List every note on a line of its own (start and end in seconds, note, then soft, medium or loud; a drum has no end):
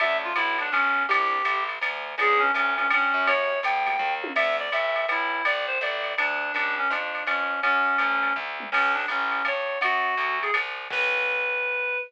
0.00 0.33 D2 medium
0.00 0.29 C#4 loud
0.00 0.29 D4 loud
0.00 0.29 E4 loud
0.00 0.29 F#4 loud
0.00 0.17 E5 loud
0.00 ride loud
0.24 0.37 F4 medium
0.36 0.70 B1 medium
0.36 0.57 E4 medium
0.36 hi-hat pedal medium
0.36 ride loud
0.58 0.72 D4 medium
0.58 ride medium
0.72 1.06 B1 medium
0.72 1.03 C#4 loud
0.72 kick medium
0.72 ride medium
1.09 1.42 C2 medium
1.09 1.37 C4 loud
1.09 1.37 D4 loud
1.09 1.37 E4 loud
1.09 1.63 G4 loud
1.09 1.37 G4 loud
1.09 ride loud
1.45 1.79 A1 medium
1.45 hi-hat pedal medium
1.45 ride medium
1.69 ride medium
1.81 2.15 D2 medium
1.81 kick medium
1.81 ride loud
2.18 2.52 C#2 medium
2.18 2.47 B3 loud
2.18 2.47 C#4 loud
2.18 2.47 D4 loud
2.18 2.47 F4 loud
2.18 2.41 G#4 loud
2.18 ride loud
2.39 2.51 C#4 loud
2.54 2.88 D2 medium
2.54 2.73 C#4 loud
2.54 hi-hat pedal medium
2.54 ride medium
2.77 3.01 B3 medium
2.77 2.88 C#4 medium
2.77 3.01 C#4 medium
2.77 3.01 D4 loud
2.77 3.01 F4 medium
2.77 ride medium
2.90 3.13 G2 medium
2.90 3.29 C#4 loud
2.90 ride loud
3.14 3.61 F#2 medium
3.27 3.55 A#3 loud
3.27 3.55 E4 loud
3.27 3.55 F#4 loud
3.27 3.55 G4 loud
3.27 3.59 C#5 loud
3.27 ride loud
3.63 3.97 D2 medium
3.63 4.14 G5 medium
3.63 hi-hat pedal medium
3.63 ride medium
3.86 4.09 A#3 loud
3.86 4.09 E4 medium
3.86 4.09 F#4 loud
3.86 4.09 G4 medium
3.86 ride medium
3.99 4.33 D#2 medium
3.99 kick medium
3.99 floor tom medium
4.23 4.32 A#3 loud
4.23 4.32 E4 medium
4.23 4.32 F#4 medium
4.23 4.32 G4 medium
4.23 high tom loud
4.35 4.69 D2 medium
4.35 4.56 E5 loud
4.35 crash medium
4.35 ride loud
4.59 4.71 D5 medium
4.72 5.06 B1 medium
4.72 5.07 E5 medium
4.72 hi-hat pedal medium
4.72 ride medium
4.96 ride medium
5.08 5.42 B1 medium
5.08 5.44 E4 medium
5.08 ride medium
5.45 5.79 C2 medium
5.45 5.66 D5 medium
5.45 ride loud
5.67 5.79 C5 medium
5.81 6.15 A1 medium
5.81 6.13 D5 medium
5.81 kick medium
5.81 hi-hat pedal medium
5.81 ride medium
6.04 ride medium
6.18 6.52 D2 medium
6.18 6.52 D4 loud
6.18 ride loud
6.54 6.88 C#2 medium
6.54 6.75 D4 loud
6.54 ride medium
6.78 6.90 C#4 medium
6.90 7.24 F2 medium
6.90 7.23 D4 medium
6.90 kick medium
6.90 hi-hat pedal medium
6.90 ride medium
7.15 ride medium
7.26 7.60 F2 medium
7.26 7.60 C#4 medium
7.26 ride loud
7.62 7.97 F#2 medium
7.62 8.33 C#4 loud
7.62 kick medium
7.62 ride medium
7.98 8.33 D2 medium
7.98 hi-hat pedal medium
7.98 ride medium
8.23 ride medium
8.36 8.70 D2 medium
8.36 kick medium
8.60 mid tom medium
8.72 9.06 C#2 medium
8.72 8.93 C#4 loud
8.72 crash medium
8.72 ride loud
8.94 9.05 D4 medium
9.08 9.42 A1 medium
9.08 9.45 C#4 medium
9.08 kick medium
9.08 hi-hat pedal medium
9.08 ride medium
9.32 ride medium
9.45 9.79 G2 medium
9.45 9.79 C#5 medium
9.45 ride medium
9.81 10.15 F#2 medium
9.81 10.39 F#4 loud
9.81 kick medium
9.81 ride loud
10.17 10.51 D2 medium
10.17 hi-hat pedal medium
10.17 ride medium
10.42 10.53 G#4 medium
10.42 ride medium
10.54 10.88 C2 medium
10.54 kick medium
10.54 ride loud
10.90 11.97 B1 medium
10.90 11.98 B4 loud
10.90 kick loud
10.90 crash loud